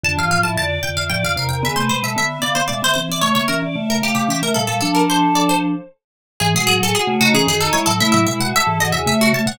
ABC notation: X:1
M:3/4
L:1/16
Q:1/4=113
K:Dm
V:1 name="Harpsichord"
a f f a a2 g f g f f g | e c c e e2 d c d c c d | ^c c B z2 B G G G B A A | A B c2 d c3 z4 |
[K:C#m] G G G A G2 F G G A c A | e e e f e2 d e e F a f |]
V:2 name="Choir Aahs"
D F2 E d2 d e d2 B B | ^G =B2 A e2 f f e2 e e | ^c e2 d e2 f f e2 f f | A6 z6 |
[K:C#m] z F2 G F2 D C z D E z | E2 E F A2 F G e3 c |]
V:3 name="Vibraphone"
[F,,D,] [G,,E,] [A,,F,] [A,,F,] [F,,D,]2 [F,,D,] [F,,D,] [A,,F,] [F,,D,] [E,,C,] [E,,C,] | [D,=B,] [C,A,] [=B,,^G,] [B,,G,] [D,B,]2 [D,B,] [D,B,] [B,,G,] [D,B,] [E,C] [E,C] | [^C,A,] [D,B,] [E,^C] [E,C] [C,A,]2 [C,A,] [C,A,] [E,C] [C,A,] [B,,G,] [B,,G,] | [F,D]8 z4 |
[K:C#m] [G,,E,] [B,,G,] [A,,F,] [A,,F,] z [C,A,] [C,A,] [E,C] [F,,D,]2 [G,E] [A,,F,] | [C,A,] [A,,F,] [B,,G,] [B,,G,] z [G,,E,] [G,,E,] [E,,C,] [C,A,]2 [C,A,] [B,,G,] |]